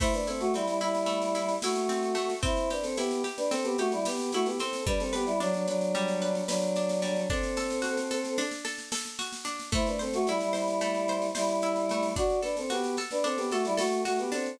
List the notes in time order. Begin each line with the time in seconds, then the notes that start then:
0.00 A3 E4 C5, kick, snare, crash
0.13 D4 B4, snare
0.27 C4 E4 A4, snare
0.40 A3 F#4, snare
0.53 G3 C4 E4, snare
0.66 G3 E4, snare
0.81 G3 E4, snare
0.95 snare
1.06 A3, snare
1.22 snare
1.35 E4, snare
1.49 snare
1.62 A3 E4 F#4, snare
1.76 snare
1.89 C4, snare
2.03 snare
2.15 A3, snare
2.30 snare
2.43 C4 E4 C5, kick, snare
2.57 snare
2.70 D4 G4 B4, snare
2.83 C4 A4, snare
2.97 B3 E4 G4, snare
3.11 snare
3.24 G4, snare
3.37 D4 B4, snare
3.51 C4 A4, snare
3.64 B3 G4, snare
3.78 A3 F#4 G4, snare
3.92 G3 E4, snare
4.05 B3 G4, snare
4.19 snare
4.32 A3 E4 F#4, snare
4.46 B3 G4, snare
4.59 C4 A4, snare
4.73 snare
4.86 G3 D4 B4, kick, snare
5.00 C4 A4, snare
5.13 B3 G4 B4, snare
5.26 G3 E4, snare
5.40 F#3 D4, snare
5.54 F#3 D4, snare
5.67 F#3 D4 B4, snare
5.81 snare
5.95 G3, snare
6.08 snare
6.22 B4, snare
6.35 snare
6.47 F#3 D4 B4, snare
6.62 snare
6.76 D4, snare
6.89 snare
7.02 G3, snare
7.16 snare
7.30 C4 D4 A4, kick, snare
7.43 snare
7.57 A4, snare
7.70 snare
7.82 F#4, snare
7.97 snare
8.11 A4, snare
8.24 snare
8.38 D4, snare
8.51 snare
8.65 A4, snare
8.78 snare
8.92 A4, snare
9.05 snare
9.19 F#4, snare
9.33 snare
9.45 D4, snare
9.59 snare
9.72 A3 E4 C5, kick, snare
9.86 D4 B4, snare
9.99 C4 A4 C5, snare
10.14 A3 F#4, snare
10.27 G3 E4, snare
10.41 G3 E4, snare
10.53 G3 E4 C5, snare
10.68 snare
10.81 A3, snare
10.95 snare
11.08 C5, snare
11.22 snare
11.35 G3 E4 C5, snare
11.49 snare
11.62 E4, snare
11.76 snare
11.89 A3, snare
12.03 snare
12.16 D4 F#4 D5, kick, snare
12.30 snare
12.42 D4 A4 B4, snare
12.57 C4 A4, snare
12.70 B3 F#4 G4, snare
12.84 snare
12.97 A4, snare
13.11 D4 B4, snare
13.24 C4 D4 A4, snare
13.37 B3 G4, snare
13.51 A3 F#4 A4, snare
13.65 G3 E4, snare
13.77 A3 F#4 A4, snare
13.92 snare
14.05 A3 F#4, snare
14.19 B3 G4, snare
14.32 C4 D4 A4, snare
14.46 snare